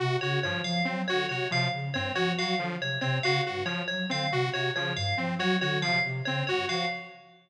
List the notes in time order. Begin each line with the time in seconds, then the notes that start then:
0.00 C3 F#4
0.21 C#3 F#4 C#5
0.43 G2 F3 C#5
0.64 F3 F5
0.85 F#3 C4
1.08 D3 F#4 C#5
1.29 C3 F#4 C#5
1.51 C3 F3 F5
1.73 C#3
1.94 G2 C4 C#5
2.15 F3 F#4 C#5
2.38 F#3 F#4 F5
2.59 D3 F3
2.81 C3 C#5
3.01 C3 C4 C#5
3.23 C#3 F#4 F5
3.45 G2 F#4
3.65 F3 C#5
3.88 F#3 C#5
4.09 D3 C4 F5
4.32 C3 F#4
4.53 C3 F#4 C#5
4.75 C#3 F3 C#5
4.96 G2 F5
5.17 F3 C4
5.39 F#3 F#4 C#5
5.61 D3 F#4 C#5
5.82 C3 F3 F5
6.04 C3
6.25 C#3 C4 C#5
6.47 G2 F#4 C#5
6.68 F3 F#4 F5